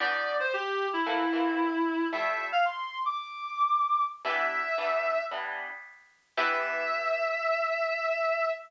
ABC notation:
X:1
M:4/4
L:1/16
Q:1/4=113
K:Ephr
V:1 name="Clarinet"
d3 c G3 E9 | e3 f c'3 d'9 | e8 z8 | e16 |]
V:2 name="Acoustic Guitar (steel)"
[E,B,DG]8 [E,A,_B,C]2 [E,A,B,C]6 | [F,G,A,E]16 | [E,G,B,D]4 [E,G,B,D]4 [E,G,B,D]8 | [E,B,DG]16 |]